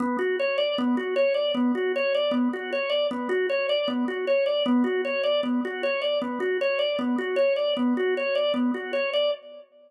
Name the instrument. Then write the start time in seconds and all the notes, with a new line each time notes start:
drawbar organ
0.00 B3
0.19 F#4
0.39 C#5
0.58 D5
0.78 B3
0.97 F#4
1.16 C#5
1.34 D5
1.54 B3
1.75 F#4
1.96 C#5
2.14 D5
2.31 B3
2.53 F#4
2.72 C#5
2.90 D5
3.11 B3
3.29 F#4
3.50 C#5
3.69 D5
3.88 B3
4.08 F#4
4.27 C#5
4.46 D5
4.66 B3
4.84 F#4
5.05 C#5
5.23 D5
5.43 B3
5.65 F#4
5.83 C#5
6.02 D5
6.22 B3
6.40 F#4
6.61 C#5
6.79 D5
6.99 B3
7.18 F#4
7.36 C#5
7.56 D5
7.77 B3
7.97 F#4
8.17 C#5
8.35 D5
8.54 B3
8.74 F#4
8.93 C#5
9.13 D5